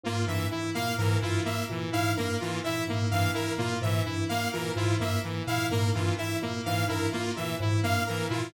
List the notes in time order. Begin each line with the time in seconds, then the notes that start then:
0.03 G#2 A#3 F4
0.26 G2 E3 E5
0.51 E4
0.75 A#2 A#3 F5
0.98 G#2 E3 A#4
1.21 G2 E4 F4
1.45 A#3 E5
1.69 A#2 E3
1.92 G#2 E4 F5
2.17 G2 A#3 A#4
2.40 E3 F4
2.64 A#2 E4 E5
2.87 G#2 A#3
3.11 G2 E3 F5
3.34 E4 A#4
3.58 A#2 A#3 F4
3.81 G#2 E3 E5
4.05 G2 E4
4.29 A#3 F5
4.53 A#2 E3 A#4
4.76 G#2 E4 F4
5.00 G2 A#3 E5
5.24 E3
5.47 A#2 E4 F5
5.71 G#2 A#3 A#4
5.94 G2 E3 F4
6.18 E4 E5
6.42 A#2 A#3
6.65 G#2 E3 F5
6.88 G2 E4 A#4
7.12 A#3 F4
7.36 A#2 E3 E5
7.60 G#2 E4
7.83 G2 A#3 F5
8.07 E3 A#4
8.29 A#2 E4 F4